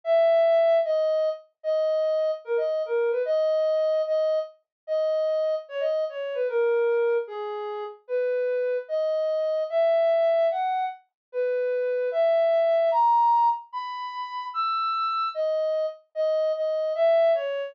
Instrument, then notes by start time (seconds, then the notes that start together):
ocarina
0.04 E5
0.85 D#5
1.63 D#5
2.45 A#4
2.57 D#5
2.86 A#4
3.11 B4
3.25 D#5
4.07 D#5
4.87 D#5
5.69 C#5
5.80 D#5
6.09 C#5
6.34 B4
6.48 A#4
7.27 G#4
8.08 B4
8.88 D#5
9.70 E5
10.51 F#5
11.32 B4
12.12 E5
12.91 A#5
13.73 B5
14.54 E6
15.34 D#5
16.15 D#5
16.56 D#5
16.95 E5
17.35 C#5